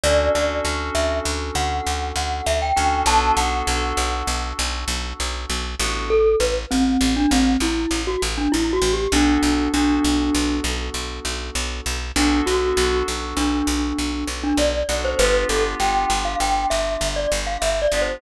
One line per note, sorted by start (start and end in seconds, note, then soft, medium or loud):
0.04 0.29 D2 loud
0.04 0.32 C#4 medium
0.04 0.32 D4 medium
0.04 0.32 F#4 medium
0.04 0.32 A4 medium
0.04 0.31 D5 loud
0.35 0.61 D2 medium
0.35 0.63 C#4 medium
0.35 0.63 D4 medium
0.35 0.63 F#4 medium
0.35 0.63 A4 medium
0.35 0.63 D5 medium
0.64 0.90 D2 medium
0.64 2.59 C#4 medium
0.64 2.59 D4 medium
0.64 2.59 F#4 medium
0.64 2.59 A4 medium
0.95 1.21 D2 medium
0.95 1.19 E5 loud
1.25 1.51 D2 medium
1.55 1.81 D2 medium
1.55 2.09 F#5 medium
1.87 2.12 D2 medium
2.16 2.41 D2 medium
2.16 2.45 F#5 medium
2.46 2.72 D2 medium
2.46 2.61 E5 loud
2.62 2.76 G5 loud
2.76 3.03 D2 medium
2.76 3.04 C#4 medium
2.76 3.04 D4 medium
2.76 3.04 F#4 medium
2.76 3.04 A4 medium
2.76 3.02 G5 medium
3.06 3.32 B1 loud
3.06 3.35 B3 medium
3.06 3.35 D4 medium
3.06 3.35 F#4 medium
3.06 3.35 A4 medium
3.06 3.36 A5 loud
3.37 3.63 B1 medium
3.37 3.65 B3 medium
3.37 3.65 D4 medium
3.37 3.65 F#4 medium
3.37 3.65 A4 medium
3.37 4.48 F#5 medium
3.67 3.93 B1 medium
3.67 5.63 B3 medium
3.67 5.63 D4 medium
3.67 5.63 F#4 medium
3.67 5.63 A4 medium
3.97 4.23 B1 medium
4.27 4.53 B1 medium
4.59 4.85 B1 loud
4.88 5.13 B1 medium
5.20 5.46 B1 medium
5.50 5.75 B1 medium
5.80 6.36 A1 loud
5.80 6.08 B3 medium
5.80 6.08 D4 medium
5.80 6.08 F#4 medium
5.80 6.08 A4 medium
6.10 6.36 A4 loud
6.40 6.66 A1 medium
6.40 6.55 B4 loud
6.71 6.97 A1 medium
6.71 7.15 C4 loud
7.01 7.27 A1 medium
7.16 7.31 D4 loud
7.31 7.57 A1 medium
7.31 7.57 C4 loud
7.60 7.86 A1 medium
7.60 8.00 E4 medium
7.91 8.17 A1 medium
8.07 8.22 F#4 medium
8.22 8.48 A1 medium
8.38 8.52 D4 medium
8.52 8.79 A1 medium
8.52 8.71 E4 loud
8.73 8.92 F#4 loud
8.82 9.07 A1 medium
8.93 9.13 G4 medium
9.12 9.38 B1 loud
9.12 9.68 B3 loud
9.12 9.68 D4 medium
9.12 9.69 D4 loud
9.12 9.68 F#4 medium
9.12 9.68 A4 medium
9.43 9.68 B1 medium
9.73 9.99 B1 medium
9.73 11.96 B3 medium
9.73 11.96 D4 medium
9.73 10.56 D4 loud
9.73 11.96 F#4 medium
9.73 11.96 A4 medium
10.05 10.30 B1 medium
10.35 10.60 B1 medium
10.64 10.90 B1 medium
10.94 11.20 B1 medium
11.25 11.51 B1 medium
11.55 11.81 B1 medium
11.86 12.12 B1 medium
12.16 12.42 B1 loud
12.16 12.44 B3 medium
12.16 12.40 D4 loud
12.16 12.44 D4 medium
12.16 12.44 F#4 medium
12.16 12.44 A4 loud
12.46 12.73 B1 medium
12.46 12.74 B3 medium
12.46 12.74 D4 medium
12.46 13.04 F#4 loud
12.46 12.74 F#4 medium
12.46 12.74 A4 medium
12.77 13.03 B1 medium
12.77 14.72 B3 medium
12.77 14.72 D4 medium
12.77 14.72 F#4 medium
12.77 14.72 A4 medium
13.08 13.34 B1 medium
13.37 13.62 B1 medium
13.37 14.25 D4 medium
13.67 13.93 B1 medium
13.99 14.24 B1 medium
14.28 14.53 B1 medium
14.43 14.58 D4 loud
14.57 14.83 B1 medium
14.57 14.98 D5 medium
14.89 15.15 B1 medium
14.89 15.16 B3 medium
14.89 15.16 D4 medium
14.89 15.16 F#4 medium
14.89 15.16 A4 medium
15.05 15.19 C5 loud
15.19 15.45 G1 loud
15.19 15.48 B3 medium
15.19 15.48 D4 medium
15.19 15.48 F4 medium
15.19 15.48 G4 medium
15.19 15.44 B4 loud
15.49 15.75 G1 medium
15.49 15.78 B3 medium
15.49 15.78 D4 medium
15.49 15.78 F4 medium
15.49 15.78 G4 medium
15.49 15.64 A4 medium
15.80 16.05 G1 medium
15.80 17.75 B3 medium
15.80 17.75 D4 medium
15.80 17.75 F4 medium
15.80 17.75 G4 medium
15.80 16.19 G5 loud
16.10 16.36 G1 medium
16.25 16.39 F5 loud
16.40 16.66 G1 medium
16.40 16.67 G5 loud
16.70 16.97 G1 medium
16.70 17.08 E5 loud
17.01 17.27 G1 medium
17.16 17.31 D5 medium
17.32 17.57 G1 medium
17.47 17.61 F5 medium
17.62 17.88 G1 medium
17.62 17.81 E5 loud
17.82 18.01 D5 loud
17.92 18.17 G1 medium
17.92 18.21 B3 medium
17.92 18.21 D4 medium
17.92 18.21 F4 medium
17.92 18.21 G4 medium
18.02 18.21 C5 medium